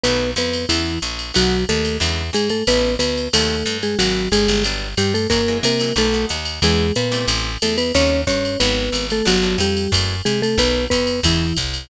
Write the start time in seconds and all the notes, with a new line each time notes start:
0.04 B1 D#3 F#3 A3 B3 B4, ride
0.36 F2 B3 B4, hi-hat pedal, ride
0.54 ride
0.69 E2 C#3 E3 G#3 B3 E4, ride
1.02 A#1, hi-hat pedal, ride
1.19 ride
1.34 B1 D#3 F#3 A3 B3 F#4, ride
1.69 D#2 A3 A4, hi-hat pedal, ride
1.85 ride
2.00 E2 C#3 D3 E3 G#3, ride
2.33 G#2 G#3 G#4, hi-hat pedal, ride
2.49 A3 A4, ride
2.67 A1 C#3 E3 A3 B3 B4, ride
2.99 D2 B3 B4, hi-hat pedal, ride
3.17 ride
3.33 D#2 C3 D#3 F#3 A3 A4, ride
3.66 G2, hi-hat pedal, ride
3.83 G#3 G#4, ride
3.99 G#1 F#3 G#3 A#3 B3 F#4, ride
4.32 G1 G#3 G#4, hi-hat pedal, ride
4.48 G1, ride
4.64 F#3 G3 B3 D4, ride
4.97 G2 G3 G4, hi-hat pedal, ride
5.14 A3 A4, ride
5.30 F#2 E3 F#3 G#3 A#3 A#4, kick, ride
5.48 E3 F#3 G#3 A#3
5.63 C3 A#3 A#4, hi-hat pedal, ride
5.80 E3 F#3 G#3 A#3, ride
5.96 B1 D#3 F#3 A3 B3 A4, ride
6.14 D#3 F#3 A3 B3
6.29 D#2, hi-hat pedal, ride
6.45 ride
6.62 E2 C#3 E3 G#3 B3 G#4, ride
6.95 A#2 B3 B4, hi-hat pedal, ride
7.12 C3 E3 G3 A3, ride
7.28 A1, ride
7.62 E2 A3 A4, hi-hat pedal, ride
7.78 B3 B4, ride
7.94 D#2 C3 C#3 D#3 G3 C#4 C#5, ride
8.27 G2 C#4 C#5, kick, hi-hat pedal, ride
8.45 ride
8.60 G#1 F#3 G#3 A#3 B3 B4, ride
8.92 G#1, hi-hat pedal, ride
9.10 A3 A4, ride
9.25 G1 F#3 G3 B3 D4 F#4, ride
9.43 F#3 G3 B3 D4
9.58 F2 G3 G4, hi-hat pedal, ride
9.77 ride
9.92 F#2 E3 F#3 G#3 A3, kick, ride
10.25 C3 G#3 G#4, hi-hat pedal, ride
10.42 A3 A4, ride
10.58 B1 D#3 F#3 A3 B3 B4, kick, ride
10.90 F2 B3 B4, kick, hi-hat pedal, ride
11.07 ride
11.23 E2 C#3 E3 G#3 B3 E4, kick, ride
11.57 C2, kick, hi-hat pedal, ride
11.74 ride